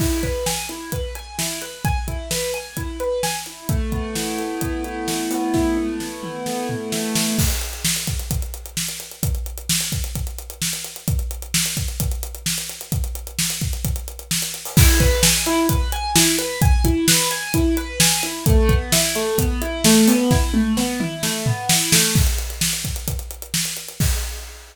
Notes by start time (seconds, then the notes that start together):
0.00 E4, kick, crash
0.23 B4, kick, closed hi-hat
0.46 G#5, snare
0.69 E4, closed hi-hat
0.92 B4, kick, closed hi-hat
1.15 G#5, closed hi-hat
1.38 E4, snare
1.62 B4, closed hi-hat
1.85 G#5, kick, closed hi-hat
2.08 E4, kick, closed hi-hat
2.31 B4, snare
2.54 G#5, closed hi-hat
2.77 E4, kick, closed hi-hat
3.00 B4, closed hi-hat
3.23 G#5, snare
3.46 E4, closed hi-hat
3.69 A3, kick, closed hi-hat
3.92 B3, kick, closed hi-hat
4.15 E4, snare
4.38 A3, closed hi-hat
4.61 B3, kick, closed hi-hat
4.84 E4, closed hi-hat
5.08 A3, snare
5.31 B3, open hi-hat
5.54 E4, kick, snare
5.77 A3, high tom
6.00 B3, snare
6.23 E4, mid tom
6.46 A3, snare
6.69 B3, floor tom
6.92 E4, snare
7.15 A3, snare
7.38 kick, crash
7.50 closed hi-hat
7.61 closed hi-hat
7.73 closed hi-hat
7.85 snare
7.96 closed hi-hat
8.07 kick, closed hi-hat
8.20 closed hi-hat
8.31 kick, closed hi-hat
8.42 closed hi-hat
8.54 closed hi-hat
8.66 closed hi-hat
8.77 snare
8.89 closed hi-hat
9.00 closed hi-hat
9.12 closed hi-hat
9.23 kick, closed hi-hat
9.35 closed hi-hat
9.46 closed hi-hat
9.58 closed hi-hat
9.69 snare
9.81 closed hi-hat
9.92 kick, closed hi-hat
10.04 closed hi-hat
10.15 kick, closed hi-hat
10.27 closed hi-hat
10.39 closed hi-hat
10.50 closed hi-hat
10.62 snare
10.73 closed hi-hat
10.84 closed hi-hat
10.96 closed hi-hat
11.08 kick, closed hi-hat
11.19 closed hi-hat
11.31 closed hi-hat
11.42 closed hi-hat
11.54 snare
11.66 closed hi-hat
11.77 kick, closed hi-hat
11.88 closed hi-hat
12.00 kick, closed hi-hat
12.12 closed hi-hat
12.23 closed hi-hat
12.35 closed hi-hat
12.46 snare
12.58 closed hi-hat
12.69 closed hi-hat
12.81 closed hi-hat
12.92 kick, closed hi-hat
13.04 closed hi-hat
13.15 closed hi-hat
13.27 closed hi-hat
13.39 snare
13.50 closed hi-hat
13.61 kick, closed hi-hat
13.73 closed hi-hat
13.85 kick, closed hi-hat
13.96 closed hi-hat
14.08 closed hi-hat
14.19 closed hi-hat
14.31 snare
14.42 closed hi-hat
14.54 closed hi-hat
14.65 open hi-hat
14.77 E4, kick, crash
15.00 B4, kick, closed hi-hat
15.23 G#5, snare
15.46 E4, closed hi-hat
15.69 B4, kick, closed hi-hat
15.92 G#5, closed hi-hat
16.15 E4, snare
16.38 B4, closed hi-hat
16.62 G#5, kick, closed hi-hat
16.84 E4, kick, closed hi-hat
17.08 B4, snare
17.31 G#5, closed hi-hat
17.54 E4, kick, closed hi-hat
17.77 B4, closed hi-hat
18.00 G#5, snare
18.23 E4, closed hi-hat
18.46 A3, kick, closed hi-hat
18.69 B3, kick, closed hi-hat
18.92 E4, snare
19.15 A3, closed hi-hat
19.38 B3, kick, closed hi-hat
19.62 E4, closed hi-hat
19.84 A3, snare
20.08 B3, open hi-hat
20.31 E4, kick, snare
20.54 A3, high tom
20.77 B3, snare
21.00 E4, mid tom
21.23 A3, snare
21.46 B3, floor tom
21.69 E4, snare
21.92 A3, snare
22.15 kick, crash
22.27 closed hi-hat
22.38 closed hi-hat
22.50 closed hi-hat
22.61 snare
22.73 closed hi-hat
22.85 kick, closed hi-hat
22.96 closed hi-hat
23.08 kick, closed hi-hat
23.19 closed hi-hat
23.31 closed hi-hat
23.42 closed hi-hat
23.54 snare
23.65 closed hi-hat
23.77 closed hi-hat
23.89 closed hi-hat
24.00 kick, crash